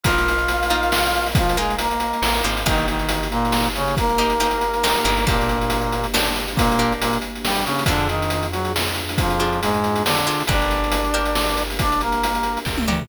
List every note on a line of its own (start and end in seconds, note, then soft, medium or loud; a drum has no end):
0.04 2.13 A#1 medium
0.04 0.37 A#3 loud
0.04 0.37 D#4 loud
0.04 1.28 F4 medium
0.04 0.37 F4 loud
0.04 2.65 A#4 loud
0.04 2.65 D#5 medium
0.04 1.28 F5 medium
0.04 2.65 F5 medium
0.04 kick loud
0.04 closed hi-hat loud
0.18 closed hi-hat medium
0.28 closed hi-hat medium
0.38 closed hi-hat medium
0.48 closed hi-hat medium
0.63 closed hi-hat medium
0.70 1.02 A#3 medium
0.70 1.02 D#4 medium
0.70 1.02 F4 medium
0.70 closed hi-hat medium
0.83 closed hi-hat medium
0.92 snare loud
1.06 closed hi-hat medium
1.15 closed hi-hat medium
1.26 open hi-hat medium
1.35 1.57 F3 medium
1.35 1.57 F4 medium
1.35 kick loud
1.35 closed hi-hat loud
1.49 closed hi-hat medium
1.57 1.76 G#3 medium
1.57 1.89 A#3 medium
1.57 1.89 D#4 medium
1.57 1.89 F4 medium
1.57 1.76 G#4 medium
1.57 closed hi-hat medium
1.70 closed hi-hat medium
1.79 2.42 A#3 medium
1.79 2.42 A#4 medium
1.79 closed hi-hat loud
1.91 closed hi-hat medium
2.00 closed hi-hat medium
2.13 closed hi-hat medium
2.22 2.42 A1 medium
2.22 snare loud
2.37 closed hi-hat medium
2.44 2.64 G#1 medium
2.44 2.61 A#3 medium
2.44 2.61 D#4 medium
2.44 2.61 F4 medium
2.44 closed hi-hat medium
2.57 closed hi-hat medium
2.65 4.95 G1 loud
2.65 2.86 D#3 medium
2.65 5.24 A#3 loud
2.65 2.98 A#3 loud
2.65 5.24 D#4 medium
2.65 2.86 D#4 medium
2.65 2.98 D#4 loud
2.65 5.24 G4 medium
2.65 2.98 G4 medium
2.65 kick medium
2.65 closed hi-hat loud
2.78 closed hi-hat medium
2.88 3.27 D#3 medium
2.88 3.27 D#4 medium
2.88 closed hi-hat medium
2.99 closed hi-hat medium
3.09 closed hi-hat loud
3.23 closed hi-hat medium
3.31 3.68 A#2 medium
3.31 3.68 A#3 medium
3.31 closed hi-hat medium
3.45 closed hi-hat medium
3.52 snare medium
3.65 closed hi-hat medium
3.75 3.95 C#3 medium
3.75 3.95 C#4 medium
3.75 closed hi-hat medium
3.88 closed hi-hat medium
3.97 5.25 A#3 medium
3.97 5.25 A#4 medium
3.97 kick loud
3.97 closed hi-hat medium
4.10 closed hi-hat medium
4.18 4.35 A#3 loud
4.18 4.35 D#4 medium
4.18 4.35 G4 medium
4.18 closed hi-hat medium
4.30 closed hi-hat medium
4.40 4.72 A#3 medium
4.40 4.72 D#4 medium
4.40 4.72 G4 medium
4.40 closed hi-hat medium
4.51 closed hi-hat medium
4.61 closed hi-hat medium
4.74 closed hi-hat medium
4.83 5.00 A#3 medium
4.83 5.00 D#4 medium
4.83 5.00 G4 medium
4.83 snare loud
4.96 closed hi-hat medium
5.04 7.67 G1 loud
5.04 5.21 A#3 medium
5.04 5.21 D#4 medium
5.04 5.21 G4 medium
5.04 closed hi-hat medium
5.17 closed hi-hat medium
5.26 6.06 A#2 medium
5.26 6.06 A#3 medium
5.26 7.85 A#3 loud
5.26 5.59 A#3 loud
5.26 7.85 D4 medium
5.26 5.59 D4 medium
5.26 7.85 G4 medium
5.26 5.59 G4 loud
5.26 kick loud
5.26 closed hi-hat medium
5.41 closed hi-hat medium
5.49 closed hi-hat medium
5.61 closed hi-hat medium
5.70 closed hi-hat loud
5.82 closed hi-hat medium
5.92 closed hi-hat medium
6.04 closed hi-hat medium
6.14 6.46 A#3 medium
6.14 6.46 D4 medium
6.14 6.46 G4 medium
6.14 snare loud
6.26 closed hi-hat medium
6.36 closed hi-hat medium
6.48 closed hi-hat medium
6.56 6.93 A#2 medium
6.56 6.93 A#3 medium
6.56 kick loud
6.56 closed hi-hat loud
6.72 closed hi-hat medium
6.79 7.11 A#3 loud
6.79 7.11 D4 medium
6.79 7.11 G4 medium
6.79 closed hi-hat medium
6.92 closed hi-hat medium
7.00 7.18 A#2 medium
7.00 7.18 A#3 medium
7.00 closed hi-hat loud
7.13 closed hi-hat medium
7.22 closed hi-hat medium
7.36 closed hi-hat medium
7.44 7.65 G3 medium
7.44 7.65 G4 medium
7.44 snare loud
7.55 closed hi-hat medium
7.65 7.84 C#3 medium
7.65 7.84 C#4 medium
7.65 closed hi-hat medium
7.79 closed hi-hat medium
7.86 10.28 F2 loud
7.86 8.08 D3 medium
7.86 10.46 D4 loud
7.86 8.08 D4 medium
7.86 8.20 D4 medium
7.86 10.46 F4 medium
7.86 8.20 F4 medium
7.86 10.46 G#4 loud
7.86 8.20 G#4 medium
7.86 kick loud
7.86 closed hi-hat loud
8.00 closed hi-hat medium
8.09 8.47 D#3 medium
8.09 8.47 D#4 medium
8.09 closed hi-hat medium
8.22 closed hi-hat medium
8.30 closed hi-hat medium
8.43 closed hi-hat medium
8.51 8.73 F#3 medium
8.51 8.73 F#4 medium
8.51 closed hi-hat medium
8.65 closed hi-hat medium
8.76 snare loud
8.88 closed hi-hat medium
8.95 closed hi-hat medium
9.09 closed hi-hat medium
9.18 9.60 F2 medium
9.18 9.60 F3 medium
9.18 kick loud
9.18 closed hi-hat medium
9.30 closed hi-hat medium
9.39 9.72 D4 medium
9.39 9.72 F4 medium
9.39 9.72 G#4 medium
9.39 closed hi-hat medium
9.53 closed hi-hat medium
9.61 10.03 G#2 medium
9.61 10.03 G#3 medium
9.61 closed hi-hat loud
9.74 closed hi-hat medium
9.84 closed hi-hat medium
9.96 closed hi-hat medium
10.04 10.43 D3 medium
10.04 10.43 D4 medium
10.04 snare loud
10.17 closed hi-hat medium
10.26 10.43 D4 medium
10.26 10.43 F4 medium
10.26 10.43 G#4 medium
10.26 closed hi-hat medium
10.40 closed hi-hat medium
10.47 12.57 G1 loud
10.47 10.80 D4 loud
10.47 11.63 D4 medium
10.47 13.08 D4 medium
10.47 10.80 G4 medium
10.47 13.08 G4 medium
10.47 10.80 A#4 loud
10.47 13.08 A#4 medium
10.47 11.63 D5 medium
10.47 kick loud
10.47 closed hi-hat loud
10.62 closed hi-hat medium
10.71 closed hi-hat medium
10.84 closed hi-hat medium
10.92 closed hi-hat loud
11.04 closed hi-hat medium
11.14 11.46 D4 medium
11.14 11.46 G4 medium
11.14 11.46 A#4 medium
11.14 closed hi-hat medium
11.25 closed hi-hat medium
11.35 snare loud
11.49 closed hi-hat medium
11.57 closed hi-hat medium
11.70 open hi-hat medium
11.79 12.01 D4 medium
11.79 12.01 D5 medium
11.79 kick medium
11.79 closed hi-hat loud
11.92 closed hi-hat medium
12.01 12.59 A#3 medium
12.01 12.59 A#4 medium
12.01 closed hi-hat medium
12.12 closed hi-hat medium
12.23 closed hi-hat loud
12.35 closed hi-hat medium
12.43 closed hi-hat medium
12.57 closed hi-hat medium
12.65 12.86 C#2 medium
12.65 kick medium
12.65 snare medium
12.78 high tom medium
12.88 13.08 D2 medium
12.88 13.04 D4 loud
12.88 13.04 G4 medium
12.88 13.04 A#4 medium
12.88 mid tom medium
13.01 floor tom loud